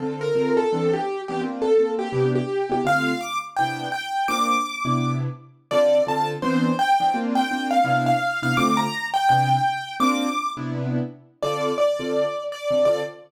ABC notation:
X:1
M:4/4
L:1/8
Q:"Swing" 1/4=168
K:Dm
V:1 name="Acoustic Grand Piano"
z B2 A2 G2 G | z A2 G2 G2 G | f2 d' z g2 g2 | d'5 z3 |
d2 a z c2 g2 | z g2 f2 f2 f | d' b2 g g4 | d'3 z5 |
d2 d4 d2 | d2 z6 |]
V:2 name="Acoustic Grand Piano"
[D,CFA]2 [D,CFA]2 [E,=B,CD]3 [E,B,CD] | [B,CDF]2 [B,CDF]2 [C,=B,DE]3 [C,B,DE] | [D,A,CF]4 [C,=B,DE]4 | [B,CDF]3 [C,=B,DE]5 |
[D,CFA]2 [D,CFA]2 [E,=B,CD]3 [E,B,CD] | [B,CDF]2 [B,CDF]2 [C,=B,DE]3 [C,B,DE] | [D,A,CF]4 [C,=B,DE]4 | [B,CDF]3 [C,=B,DE]5 |
[D,CFA]3 [D,CFA]4 [D,CFA] | [D,CFA]2 z6 |]